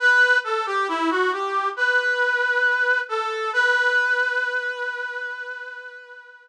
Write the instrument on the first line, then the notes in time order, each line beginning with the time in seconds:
brass section
0.00 B4
0.44 A4
0.66 G4
0.88 E4
1.10 F#4
1.32 G4
1.76 B4
3.09 A4
3.53 B4